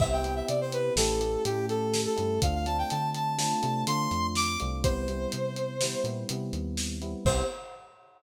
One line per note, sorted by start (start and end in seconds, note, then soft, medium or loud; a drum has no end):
0.00 0.42 C2 medium
0.00 0.22 B3 loud
0.00 0.22 C4 loud
0.00 0.22 E4 medium
0.00 0.22 G4 loud
0.00 0.12 E5 loud
0.00 kick loud
0.00 crash medium
0.12 0.34 G5 medium
0.24 0.91 B3 medium
0.24 0.91 C4 medium
0.24 0.91 E4 medium
0.24 0.91 G4 medium
0.24 closed hi-hat medium
0.36 0.47 E5 medium
0.48 0.90 C3 medium
0.48 0.60 D5 medium
0.48 closed hi-hat medium
0.61 0.72 C5 medium
0.72 0.94 B4 medium
0.72 closed hi-hat medium
0.96 1.37 A1 medium
0.96 1.20 A3 loud
0.96 1.20 C#4 loud
0.96 1.20 E4 loud
0.96 1.20 G4 loud
0.96 1.44 A4 medium
0.96 snare loud
1.21 1.43 A3 medium
1.21 1.43 C#4 medium
1.21 1.43 E4 medium
1.21 1.43 G4 medium
1.21 closed hi-hat medium
1.45 2.07 A2 medium
1.45 2.13 A3 medium
1.45 2.13 C#4 loud
1.45 2.13 E4 medium
1.45 1.66 G4 medium
1.45 2.13 G4 medium
1.45 closed hi-hat medium
1.69 2.01 A4 medium
1.69 closed hi-hat medium
1.94 snare medium
2.06 2.40 A4 medium
2.17 2.39 G2 medium
2.17 2.39 A3 medium
2.17 2.39 C#4 medium
2.17 2.39 E4 medium
2.17 2.39 G4 medium
2.17 closed hi-hat medium
2.42 2.84 D2 medium
2.42 2.65 A3 medium
2.42 2.65 C4 medium
2.42 2.65 D4 loud
2.42 2.65 F4 medium
2.42 2.54 F5 medium
2.42 kick medium
2.42 closed hi-hat loud
2.55 2.66 F5 medium
2.66 3.33 A3 medium
2.66 3.33 C4 medium
2.66 3.33 D4 loud
2.66 3.33 F4 medium
2.66 2.77 A5 medium
2.66 closed hi-hat medium
2.78 2.90 G5 medium
2.90 3.53 D3 medium
2.90 3.10 A5 medium
2.90 closed hi-hat medium
3.15 3.38 A5 medium
3.15 closed hi-hat medium
3.38 3.60 A3 medium
3.38 3.60 C4 medium
3.38 3.60 D4 medium
3.38 3.60 F4 medium
3.38 3.83 A5 medium
3.38 snare loud
3.62 3.84 C3 medium
3.62 3.84 A3 medium
3.62 3.84 C4 medium
3.62 3.84 D4 medium
3.62 3.84 F4 medium
3.62 closed hi-hat medium
3.87 4.08 D3 medium
3.87 4.55 A3 medium
3.87 4.55 C4 medium
3.87 4.55 D4 medium
3.87 4.55 F4 medium
3.87 4.27 C6 medium
3.87 closed hi-hat loud
4.11 4.57 F2 medium
4.11 closed hi-hat medium
4.35 4.59 D6 medium
4.35 snare medium
4.60 5.27 C2 medium
4.60 4.82 A3 medium
4.60 4.82 C4 medium
4.60 4.82 D4 medium
4.60 4.82 F4 medium
4.60 closed hi-hat medium
4.84 5.06 G3 loud
4.84 5.06 B3 medium
4.84 5.06 C4 medium
4.84 5.06 E4 loud
4.84 6.04 C5 medium
4.84 kick loud
4.84 closed hi-hat medium
5.08 5.75 G3 medium
5.08 5.75 B3 medium
5.08 5.75 C4 medium
5.08 5.75 E4 medium
5.08 closed hi-hat medium
5.32 5.95 C3 medium
5.32 closed hi-hat medium
5.56 closed hi-hat medium
5.81 6.04 G3 medium
5.81 6.04 B3 medium
5.81 6.04 C4 medium
5.81 6.04 E4 medium
5.81 snare loud
6.04 6.25 A#2 medium
6.04 6.28 G3 medium
6.04 6.28 B3 medium
6.04 6.28 C4 medium
6.04 6.28 E4 medium
6.04 closed hi-hat medium
6.29 6.51 C3 medium
6.29 6.96 G3 medium
6.29 6.96 B3 medium
6.29 6.96 C4 medium
6.29 6.96 E4 medium
6.29 closed hi-hat loud
6.53 7.15 D#2 medium
6.53 closed hi-hat medium
6.77 snare medium
7.02 7.24 G3 medium
7.02 7.24 B3 medium
7.02 7.24 C4 medium
7.02 7.24 E4 medium
7.02 closed hi-hat medium
7.25 7.42 C2 loud
7.25 7.43 B3 medium
7.25 7.43 C4 loud
7.25 7.43 E4 medium
7.25 7.43 G4 loud
7.25 7.43 C5 loud
7.25 kick loud
7.25 crash loud